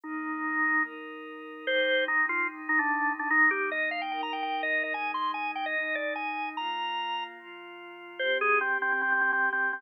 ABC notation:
X:1
M:4/4
L:1/16
Q:1/4=147
K:Cm
V:1 name="Drawbar Organ"
E8 z8 | c4 E2 F2 z2 E D4 D | E2 G2 e2 f g g b g g2 e2 e | a2 c'2 a2 g e3 d2 a4 |
b8 z8 | c2 A2 C2 C C C C C C2 C2 C |]
V:2 name="Pad 5 (bowed)"
[E,B,E]8 [E,EB]8 | [C,G,E]8 [C,E,E]8 | [E,B,E]8 [E,EB]8 | [A,,A,E]8 [A,,E,E]8 |
[B,,B,F]8 [B,,F,F]8 | [C,CG]8 [C,G,G]8 |]